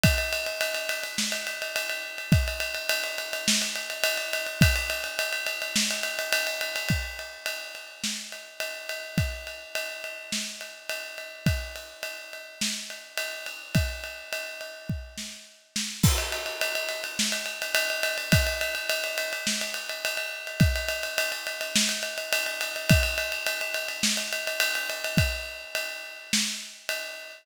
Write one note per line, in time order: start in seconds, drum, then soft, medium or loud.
0.03 kick loud
0.03 ride loud
0.18 ride medium
0.33 ride medium
0.46 ride medium
0.61 ride loud
0.75 ride medium
0.89 ride loud
1.03 ride medium
1.18 snare loud
1.32 ride medium
1.47 ride medium
1.62 ride medium
1.76 ride loud
1.90 ride medium
2.18 ride medium
2.32 kick loud
2.32 ride medium
2.48 ride medium
2.60 ride medium
2.75 ride medium
2.89 ride loud
3.04 ride medium
3.18 ride medium
3.33 ride medium
3.48 snare loud
3.62 ride medium
3.76 ride medium
3.90 ride medium
4.04 ride loud
4.18 ride medium
4.33 ride medium
4.46 ride medium
4.61 kick loud
4.61 ride loud
4.76 ride medium
4.90 ride medium
5.04 ride medium
5.19 ride loud
5.33 ride medium
5.47 ride medium
5.62 ride medium
5.76 snare loud
5.91 ride medium
6.03 ride medium
6.19 ride medium
6.33 ride loud
6.47 ride medium
6.61 ride medium
6.76 ride medium
6.89 kick medium
6.89 ride medium
7.19 ride medium
7.46 ride medium
7.75 ride medium
8.04 snare medium
8.32 ride medium
8.60 ride medium
8.89 ride medium
9.18 kick medium
9.18 ride medium
9.47 ride medium
9.75 ride medium
10.04 ride medium
10.32 snare medium
10.61 ride medium
10.89 ride medium
11.18 ride medium
11.46 kick medium
11.46 ride medium
11.76 ride medium
12.03 ride medium
12.33 ride medium
12.61 snare loud
12.90 ride medium
13.18 ride medium
13.46 ride medium
13.75 kick medium
13.75 ride medium
14.04 ride medium
14.33 ride medium
14.61 ride medium
14.89 kick medium
15.18 snare medium
15.76 snare medium
16.03 kick loud
16.03 crash loud
16.18 ride medium
16.32 ride medium
16.46 ride medium
16.61 ride loud
16.75 ride medium
16.89 ride medium
17.04 ride medium
17.19 snare loud
17.32 ride medium
17.46 ride medium
17.62 ride medium
17.75 ride loud
17.90 ride medium
18.03 ride loud
18.18 ride medium
18.32 kick loud
18.32 ride loud
18.47 ride medium
18.61 ride medium
18.75 ride medium
18.90 ride loud
19.04 ride medium
19.18 ride loud
19.33 ride medium
19.47 snare loud
19.61 ride medium
19.74 ride medium
19.89 ride medium
20.05 ride loud
20.17 ride medium
20.47 ride medium
20.60 kick loud
20.60 ride medium
20.76 ride medium
20.88 ride medium
21.03 ride medium
21.18 ride loud
21.32 ride medium
21.47 ride medium
21.61 ride medium
21.76 snare loud
21.89 ride medium
22.03 ride medium
22.18 ride medium
22.33 ride loud
22.46 ride medium
22.61 ride medium
22.76 ride medium
22.89 kick loud
22.89 ride loud
23.03 ride medium
23.18 ride medium
23.32 ride medium
23.47 ride loud
23.61 ride medium
23.74 ride medium
23.88 ride medium
24.03 snare loud
24.17 ride medium
24.33 ride medium
24.47 ride medium
24.60 ride loud
24.75 ride medium
24.90 ride medium
25.04 ride medium
25.17 kick loud
25.17 ride loud
25.75 ride loud
26.33 snare loud
26.89 ride loud